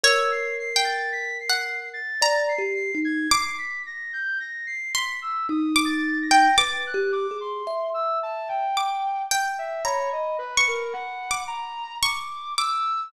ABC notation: X:1
M:3/4
L:1/16
Q:1/4=55
K:none
V:1 name="Orchestral Harp"
(3^c4 g4 ^f4 ^a z3 | d'6 c'3 d'2 g | d'8 d'2 g2 | (3^a4 ^c'4 d'4 c'2 d'2 |]
V:2 name="Kalimba"
^A8 (3d2 G2 ^D2 | z8 ^D4 | (3B2 G2 ^G2 e4 z4 | b12 |]
V:3 name="Flute"
e' c'' c'' a' b' c''2 a'2 c'' c'' ^g' | c'' b' ^a' g' a' c'' b' e' (3^d'2 =a'2 ^a'2 | a' ^f' d' c'2 e' a g3 z e | ^c ^d B ^A ^f2 ^a2 =d'2 e'2 |]